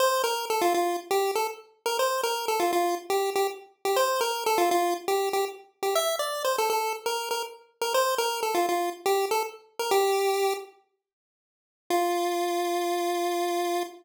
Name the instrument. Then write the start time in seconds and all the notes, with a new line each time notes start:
lead 1 (square)
0.00 C5
0.24 A#4
0.50 A4
0.61 F4
0.74 F4
1.11 G4
1.35 A4
1.86 A#4
1.99 C5
2.23 A#4
2.48 A4
2.60 F4
2.73 F4
3.10 G4
3.36 G4
3.85 G4
3.96 C5
4.21 A#4
4.46 A4
4.58 F4
4.71 F4
5.08 G4
5.33 G4
5.83 G4
5.95 E5
6.19 D5
6.45 C5
6.58 A4
6.70 A4
7.06 A#4
7.31 A#4
7.82 A#4
7.94 C5
8.18 A#4
8.43 A4
8.55 F4
8.69 F4
9.06 G4
9.31 A4
9.79 A#4
9.91 G4
11.90 F4